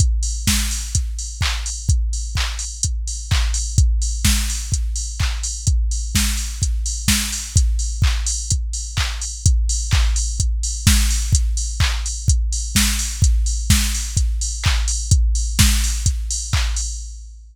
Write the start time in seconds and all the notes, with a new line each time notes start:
0.00 kick, closed hi-hat
0.23 open hi-hat
0.47 kick, snare
0.71 open hi-hat
0.95 kick, closed hi-hat
1.19 open hi-hat
1.41 kick, clap
1.66 open hi-hat
1.89 kick, closed hi-hat
2.13 open hi-hat
2.35 kick, clap
2.59 open hi-hat
2.83 kick, closed hi-hat
3.07 open hi-hat
3.31 kick, clap
3.54 open hi-hat
3.78 kick, closed hi-hat
4.02 open hi-hat
4.25 kick, snare
4.50 open hi-hat
4.72 kick, closed hi-hat
4.96 open hi-hat
5.20 kick, clap
5.43 open hi-hat
5.67 kick, closed hi-hat
5.91 open hi-hat
6.15 kick, snare
6.37 open hi-hat
6.62 kick, closed hi-hat
6.86 open hi-hat
7.08 kick, snare
7.32 open hi-hat
7.56 kick, closed hi-hat
7.79 open hi-hat
8.02 kick, clap
8.26 open hi-hat
8.50 kick, closed hi-hat
8.73 open hi-hat
8.97 kick, clap
9.22 open hi-hat
9.46 kick, closed hi-hat
9.69 open hi-hat
9.91 kick, clap
10.16 open hi-hat
10.40 kick, closed hi-hat
10.63 open hi-hat
10.87 kick, snare
11.11 open hi-hat
11.33 kick, closed hi-hat
11.57 open hi-hat
11.80 kick, clap
12.06 open hi-hat
12.28 kick, closed hi-hat
12.53 open hi-hat
12.75 kick, snare
12.99 open hi-hat
13.22 kick, closed hi-hat
13.46 open hi-hat
13.70 kick, snare
13.95 open hi-hat
14.17 kick, closed hi-hat
14.41 open hi-hat
14.64 kick, clap
14.88 open hi-hat
15.11 kick, closed hi-hat
15.35 open hi-hat
15.59 kick, snare
15.84 open hi-hat
16.06 kick, closed hi-hat
16.31 open hi-hat
16.53 kick, clap
16.76 open hi-hat